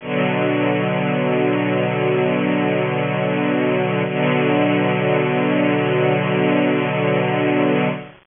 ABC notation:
X:1
M:4/4
L:1/8
Q:1/4=59
K:Bm
V:1 name="String Ensemble 1" clef=bass
[B,,D,F,]8 | [B,,D,F,]8 |]